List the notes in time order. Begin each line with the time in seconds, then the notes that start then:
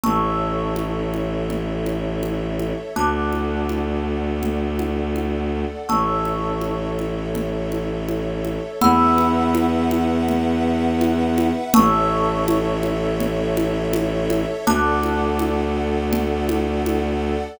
0.04 A1 A4 C#5 E5 A5 C#6 E6, low conga
0.76 high conga
1.14 high conga
1.50 low conga
1.86 high conga
2.23 high conga
2.59 high conga
2.95 D2 A4 D5 F#5 A5 D6 F#6, low conga
3.33 high conga
3.69 high conga
4.43 low conga
4.79 high conga
5.16 high conga
5.89 A1 A4 C#5 E5 A5 C#6 E6, low conga
6.25 high conga
6.61 high conga
6.99 high conga
7.35 low conga
7.72 high conga
8.09 high conga
8.45 high conga
8.81 E2 B4 E5 F#5 B5 E6, low conga
9.18 high conga
9.55 high conga
9.91 high conga
10.29 low conga
11.01 high conga
11.38 high conga
11.74 A1 A4 C#5 E5 A5 C#6 E6, low conga
12.48 high conga
12.83 high conga
13.20 low conga
13.57 high conga
13.93 high conga
14.30 high conga
14.67 D2 A4 D5 F#5 A5 D6 F#6, low conga
15.03 high conga
15.39 high conga
16.13 low conga
16.49 high conga
16.86 high conga